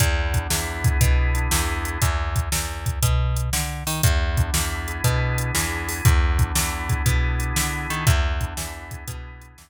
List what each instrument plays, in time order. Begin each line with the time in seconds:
0.00 electric bass (finger) E2, drawbar organ B3, kick, closed hi-hat
0.34 drawbar organ D4, kick, closed hi-hat
0.50 electric bass (finger) E2, drawbar organ E4, snare
0.84 drawbar organ G#4, kick, closed hi-hat
1.01 electric bass (finger) B2, drawbar organ B3, kick, closed hi-hat
1.35 drawbar organ D4, closed hi-hat
1.51 electric bass (finger) E2, drawbar organ E4, snare
1.85 drawbar organ G#4, closed hi-hat
2.02 electric bass (finger) E2, kick, closed hi-hat
2.36 kick, closed hi-hat
2.52 electric bass (finger) E2, snare
2.86 kick, closed hi-hat
3.03 electric bass (finger) B2, kick, closed hi-hat
3.36 closed hi-hat
3.53 electric bass (finger) D3, snare
3.87 electric bass (finger) D#3, open hi-hat
4.03 electric bass (finger) E2, drawbar organ B3, kick, closed hi-hat
4.37 drawbar organ D4, kick, closed hi-hat
4.54 electric bass (finger) E2, drawbar organ E4, snare
4.88 drawbar organ G#4, closed hi-hat
5.04 electric bass (finger) B2, drawbar organ B3, kick, closed hi-hat
5.38 drawbar organ D4, closed hi-hat
5.55 electric bass (finger) E2, drawbar organ E4, snare
5.89 drawbar organ G#4, open hi-hat
6.05 electric bass (finger) E2, drawbar organ B3, kick, closed hi-hat
6.39 drawbar organ D4, kick, closed hi-hat
6.55 electric bass (finger) E2, drawbar organ E4, snare
6.89 drawbar organ G#4, kick, closed hi-hat
7.06 electric bass (finger) B2, drawbar organ B3, kick, closed hi-hat
7.40 drawbar organ D4, closed hi-hat
7.56 electric bass (finger) D3, drawbar organ E4, snare
7.90 electric bass (finger) D#3, drawbar organ G#4, closed hi-hat
8.07 electric bass (finger) E2, drawbar organ B3, kick, closed hi-hat
8.41 drawbar organ D4, kick, closed hi-hat
8.57 electric bass (finger) E2, drawbar organ E4, snare
8.91 drawbar organ G#4, kick, closed hi-hat
9.08 electric bass (finger) B2, drawbar organ B3, kick, closed hi-hat
9.41 drawbar organ D4, closed hi-hat
9.58 electric bass (finger) E2, drawbar organ E4, snare